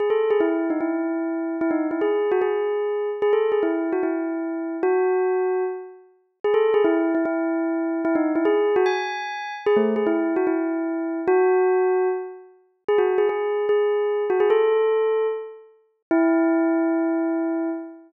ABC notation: X:1
M:4/4
L:1/16
Q:1/4=149
K:E
V:1 name="Tubular Bells"
G A2 G E3 D E8 | E D2 E G3 F G8 | G A2 G E3 F E8 | F10 z6 |
G A2 G E3 E E8 | E D2 E G3 F g8 | G A,2 G E3 F E8 | F10 z6 |
G F2 G G4 G6 F G | A8 z8 | E16 |]